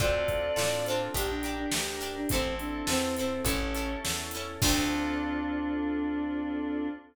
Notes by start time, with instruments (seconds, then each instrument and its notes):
0.00 electric bass (finger) D2, electric piano 2 C4 D4 F4 A4, string ensemble 1 C4 D4 F4 A4, pizzicato strings C4 D4 F4 A4, choir aahs D5, kick
0.28 kick, closed hi-hat
0.56 electric bass (finger) A2, pizzicato strings C4 D4 F4 A4, snare
0.86 pizzicato strings D4 F4 A4, choir aahs C5, closed hi-hat
0.91 pizzicato strings C4
1.14 electric bass (finger) A#1, string ensemble 1 D4 G4 A#4, electric piano 2 D4 G4 A#4, pizzicato strings D4 G4 A#4, choir aahs G4, kick, closed hi-hat
1.30 choir aahs D4
1.43 pizzicato strings D4 G4 A#4, closed hi-hat
1.59 choir aahs D4
1.72 electric bass (finger) D2, snare
2.01 pizzicato strings D4 G4 A#4, closed hi-hat
2.16 choir aahs D4
2.29 electric bass (finger) A1, string ensemble 1 C4 E4 A4, choir aahs C4, electric piano 2 C4 E4 A4, pizzicato strings A4, kick, closed hi-hat
2.33 pizzicato strings C4 E4
2.59 choir aahs D4, closed hi-hat
2.87 electric bass (finger) E2, choir aahs C4, pizzicato strings C4 E4 A4, snare
3.16 choir aahs C4, pizzicato strings C4 E4 A4, closed hi-hat
3.44 electric bass (finger) A1, choir aahs C#4, string ensemble 1 C#4 E4 A4, electric piano 2 C#4 E4 A4, pizzicato strings C#4 E4 A4, kick, closed hi-hat
3.75 pizzicato strings C#4 E4 A4, closed hi-hat
4.05 electric bass (finger) E2, snare
4.31 pizzicato strings A4, closed hi-hat
4.36 pizzicato strings C#4 E4
4.61 electric bass (finger) D2, string ensemble 1 C4 D4 F4 A4, electric piano 2 C4 D4 F4 A4, choir aahs D4, pizzicato strings D4 F4 A4, kick, crash
4.65 pizzicato strings C4